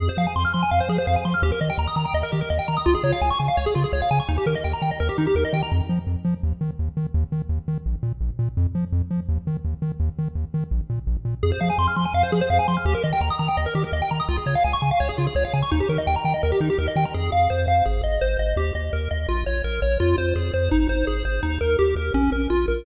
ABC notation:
X:1
M:4/4
L:1/16
Q:1/4=168
K:Fm
V:1 name="Lead 1 (square)"
A c f a c' f' c' a f c A c f a c' f' | G B e g b e' b g e B G B e g b e' | F A d f a d' a f d A F A d f a d' | E G B e g b g e B G E G B e g b |
z16 | z16 | z16 | z16 |
A c f a c' f' c' a f c A c f a c' f' | G B e g b e' b g e B G B e g b e' | F A d f a d' a f d A F A d f a d' | E G B e g b g e B G E G B e g b |
A2 f2 c2 f2 A2 e2 c2 e2 | G2 e2 B2 e2 F2 d2 B2 d2 | F2 c2 A2 c2 E2 c2 A2 c2 | E2 B2 G2 B2 D2 B2 F2 B2 |]
V:2 name="Synth Bass 1" clef=bass
F,,2 F,2 F,,2 F,2 F,,2 F,2 F,,2 F,2 | E,,2 E,2 E,,2 E,2 E,,2 E,2 E,,2 E,2 | D,,2 D,2 D,,2 D,2 D,,2 D,2 D,,2 D,2 | E,,2 E,2 E,,2 E,2 E,,2 E,2 E,,2 E,2 |
F,,2 F,2 F,,2 F,2 E,,2 E,2 E,,2 E,2 | E,,2 E,2 E,,2 E,2 B,,,2 B,,2 B,,,2 B,,2 | F,,2 F,2 F,,2 F,2 E,,2 E,2 E,,2 E,2 | E,,2 E,2 E,,2 E,2 B,,,2 B,,2 B,,,2 B,,2 |
F,,2 F,2 F,,2 F,2 F,,2 F,2 F,,2 F,2 | E,,2 E,2 E,,2 E,2 E,,2 E,2 E,,2 E,2 | D,,2 D,2 D,,2 D,2 D,,2 D,2 D,,2 D,2 | E,,2 E,2 E,,2 E,2 E,,2 E,2 E,,2 E,2 |
F,,2 F,,2 F,,2 F,,2 A,,,2 A,,,2 A,,,2 A,,,2 | E,,2 E,,2 E,,2 E,,2 B,,,2 B,,,2 B,,,2 B,,,2 | F,,2 F,,2 F,,2 F,,2 A,,,2 A,,,2 A,,,2 A,,,2 | E,,2 E,,2 E,,2 E,,2 B,,,2 B,,,2 B,,,2 B,,,2 |]